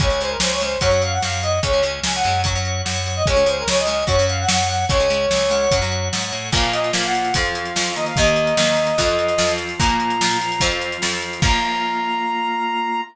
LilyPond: <<
  \new Staff \with { instrumentName = "Brass Section" } { \time 4/4 \key des \major \tempo 4 = 147 des''8 c''16 bes'16 c''16 des''16 c''8 des''8 f''16 ges''16 f''8 ees''8 | des''8 r8 aes''16 ges''8. r4. r16 ees''16 | des''8 c''16 bes'16 des''16 ees''16 ees''8 des''8 f''16 ges''16 ges''8 ges''8 | des''2~ des''8 r4. |
\key bes \minor f''8 ees''8 f''16 ges''8. f''4. ees''16 f''16 | ees''1 | bes''2~ bes''8 r4. | bes''1 | }
  \new Staff \with { instrumentName = "Acoustic Guitar (steel)" } { \time 4/4 \key des \major <aes des'>16 <aes des'>16 <aes des'>4 <aes des'>8 <ges des'>16 <ges des'>4.~ <ges des'>16 | <aes des'>16 <aes des'>16 <aes des'>4 <aes des'>8 <ges des'>16 <ges des'>4.~ <ges des'>16 | <aes des'>16 <aes des'>16 <aes des'>4 <aes des'>8 <ges des'>16 <ges des'>4.~ <ges des'>16 | <aes des'>16 <aes des'>16 <aes des'>4 <aes des'>8 <ges des'>16 <ges des'>4.~ <ges des'>16 |
\key bes \minor <bes, f bes>4 <bes, f bes>4 <f, f c'>4 <f, f c'>4 | <ees, ees bes>4 <ees, ees bes>4 <f, f c'>4 <f, f c'>4 | <bes, f bes>4 <bes, f bes>4 <f, f c'>4 <f, f c'>4 | <f bes>1 | }
  \new Staff \with { instrumentName = "Drawbar Organ" } { \time 4/4 \key des \major <des'' aes''>4 <des'' aes''>4 <des'' ges''>4 <des'' ges''>4 | <des'' aes''>4 <des'' aes''>4 <des'' ges''>4 <des'' ges''>4 | <des'' aes''>4 <des'' aes''>4 <des'' ges''>4 <des'' ges''>4 | <des'' aes''>4 <des'' aes''>8 <des'' ges''>4. <des'' ges''>4 |
\key bes \minor <bes, bes f'>2 <f c' f'>4. <ees bes ees'>8~ | <ees bes ees'>2 <f c' f'>2 | <bes, bes f'>4. <f c' f'>2~ <f c' f'>8 | <bes f'>1 | }
  \new Staff \with { instrumentName = "Electric Bass (finger)" } { \clef bass \time 4/4 \key des \major des,4 des,4 ges,4 ges,4 | des,4 des,8 ges,4. ges,4 | des,4 des,4 ges,4 ges,4 | des,4 des,4 ges,4 aes,8 a,8 |
\key bes \minor r1 | r1 | r1 | r1 | }
  \new DrumStaff \with { instrumentName = "Drums" } \drummode { \time 4/4 <hh bd>8 hh8 sn8 hh8 <hh bd>8 hh8 sn8 hh8 | <hh bd>8 hh8 sn8 hh8 <hh bd>8 hh8 sn8 hh8 | <hh bd>8 hh8 sn8 hh8 <hh bd>8 hh8 sn8 hh8 | <hh bd>8 hh8 sn8 hh8 <hh bd>8 hh8 sn8 hh8 |
<cymc bd>16 hh16 hh16 hh16 sn16 hh16 hh16 hh16 <hh bd>16 hh16 hh16 hh16 sn16 hh16 hh16 hh16 | <hh bd>16 hh16 hh16 hh16 sn16 hh16 hh16 hh16 <hh bd>16 hh16 hh16 hh16 sn16 hh16 hh16 hh16 | <hh bd>16 hh16 hh16 hh16 sn16 hh16 hh16 hh16 <hh bd>16 hh16 hh16 hh16 sn16 hh16 hh16 hh16 | <cymc bd>4 r4 r4 r4 | }
>>